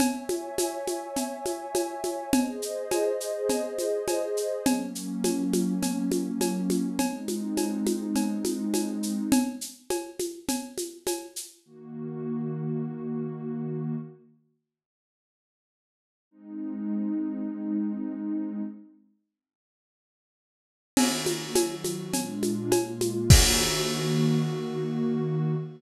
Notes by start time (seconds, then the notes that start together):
0.00 C#5 E5 G#5, cowbell, low conga, shaker
0.29 high conga, shaker
0.58 cowbell, high conga, shaker
0.87 high conga, shaker
1.16 cowbell, low conga, shaker
1.46 high conga, shaker
1.75 cowbell, high conga, shaker
2.04 high conga, shaker
2.33 G#4 C5 D#5, cowbell, low conga, shaker
2.62 shaker
2.91 cowbell, high conga, shaker
3.21 shaker
3.49 cowbell, low conga, shaker
3.79 high conga, shaker
4.08 cowbell, high conga, shaker
4.37 shaker
4.66 F#3 A#3 C#4, cowbell, low conga, shaker
4.95 shaker
5.24 cowbell, high conga, shaker
5.53 high conga, shaker
5.83 cowbell, low conga, shaker
6.12 high conga, shaker
6.41 cowbell, high conga, shaker
6.70 high conga, shaker
6.99 G#3 C4 D#4, cowbell, low conga, shaker
7.28 high conga, shaker
7.57 cowbell, high conga, shaker
7.86 high conga, shaker
8.16 cowbell, low conga, shaker
8.45 high conga, shaker
8.74 cowbell, high conga, shaker
9.03 shaker
9.32 cowbell, low conga, shaker
9.61 shaker
9.90 cowbell, high conga, shaker
10.19 high conga, shaker
10.49 cowbell, low conga, shaker
10.78 high conga, shaker
11.07 cowbell, high conga, shaker
11.36 shaker
11.65 D#3 A#3 F#4
16.31 G#3 C4 D#4
20.97 D#3 A#3 F#4, crash, cowbell, low conga, shaker
21.26 high conga, shaker
21.55 D#3 F#3 F#4, cowbell, high conga, shaker
21.84 high conga, shaker
22.13 A#2 G#3 D4 F4, cowbell, low conga, shaker
22.43 high conga, shaker
22.72 A#2 G#3 A#3 F4, cowbell, high conga, shaker
23.01 high conga, shaker
23.30 D#3 A#3 F#4, kick, crash